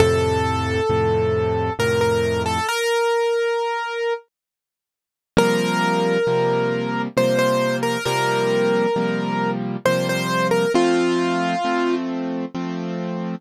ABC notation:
X:1
M:3/4
L:1/16
Q:1/4=67
K:F
V:1 name="Acoustic Grand Piano"
A8 B B2 A | B8 z4 | B8 c c2 B | B8 c c2 B |
F6 z6 |]
V:2 name="Acoustic Grand Piano"
[F,,A,,C,]4 [F,,A,,C,]4 [F,,A,,C,]4 | z12 | [C,F,G,B,]4 [C,F,G,B,]4 [C,F,G,B,]4 | [C,F,G,B,]4 [C,F,G,B,]4 [C,F,G,B,]4 |
[F,A,C]4 [F,A,C]4 [F,A,C]4 |]